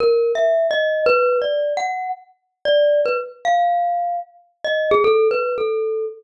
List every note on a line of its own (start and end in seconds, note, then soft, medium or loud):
0.00 0.32 A#4 loud
0.35 0.67 E5 medium
0.71 1.03 D#5 medium
1.06 1.38 B4 loud
1.42 1.73 D5 medium
1.77 2.09 F#5 medium
2.65 3.01 D5 medium
3.06 3.17 B4 medium
3.45 4.17 F5 medium
4.64 4.88 D#5 medium
4.91 5.03 G#4 loud
5.04 5.28 A4 loud
5.31 5.55 B4 medium
5.58 6.06 A4 medium